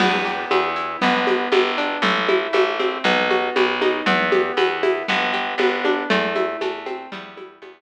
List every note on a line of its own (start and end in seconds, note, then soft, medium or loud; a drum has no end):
0.00 0.46 E2 medium
0.00 0.50 B3 medium
0.00 crash loud
0.00 low conga loud
0.00 shaker medium
0.25 0.98 G4 medium
0.25 shaker medium
0.51 0.97 E2 medium
0.51 0.99 B3 medium
0.51 high conga medium
0.51 shaker medium
0.76 1.00 E4 medium
0.76 shaker medium
1.01 1.49 G1 medium
1.01 1.52 B3 loud
1.01 low conga medium
1.01 shaker medium
1.27 2.00 G4 medium
1.27 high conga medium
1.27 shaker medium
1.52 1.98 G1 medium
1.52 2.01 B3 medium
1.52 high conga medium
1.52 shaker medium
1.78 2.02 D4 medium
1.78 shaker medium
2.02 2.48 A1 medium
2.02 2.54 A3 medium
2.02 low conga medium
2.02 shaker medium
2.29 3.01 E4 medium
2.29 high conga medium
2.29 shaker medium
2.53 2.99 A1 medium
2.53 3.03 A3 medium
2.53 high conga medium
2.53 shaker medium
2.79 3.04 C4 medium
2.79 high conga medium
2.79 shaker medium
3.04 3.50 B1 medium
3.04 3.55 B3 medium
3.04 low conga medium
3.04 shaker medium
3.30 4.03 F#4 medium
3.30 high conga medium
3.30 shaker medium
3.56 4.02 B1 medium
3.56 4.04 B3 medium
3.56 high conga medium
3.56 shaker medium
3.81 4.06 D#4 medium
3.81 high conga medium
3.81 shaker medium
4.06 4.52 E2 medium
4.06 4.57 B3 medium
4.06 low conga loud
4.06 shaker medium
4.32 5.04 G4 medium
4.32 high conga medium
4.32 shaker medium
4.57 5.03 E2 medium
4.57 5.06 B3 medium
4.57 high conga medium
4.57 shaker medium
4.83 5.07 E4 medium
4.83 high conga medium
4.83 shaker medium
5.08 5.55 G1 medium
5.08 5.59 B3 medium
5.08 low conga medium
5.08 shaker medium
5.34 6.06 G4 medium
5.34 shaker medium
5.58 6.04 G1 medium
5.58 6.07 B3 medium
5.58 high conga medium
5.58 shaker medium
5.85 6.09 D4 medium
5.85 high conga medium
5.85 shaker medium
6.10 6.57 E2 medium
6.10 6.61 A3 loud
6.10 low conga medium
6.10 shaker medium
6.35 7.08 E4 medium
6.35 high conga medium
6.35 shaker medium
6.61 7.07 E2 medium
6.61 7.10 A3 medium
6.61 high conga medium
6.61 shaker medium
6.86 7.10 C4 medium
6.86 high conga medium
6.86 shaker medium
7.12 7.59 E2 medium
7.12 7.62 G3 medium
7.12 low conga medium
7.12 shaker medium
7.37 7.81 E4 medium
7.37 high conga medium
7.37 shaker medium
7.62 7.81 E2 medium
7.62 7.81 G3 medium
7.62 high conga loud
7.62 shaker medium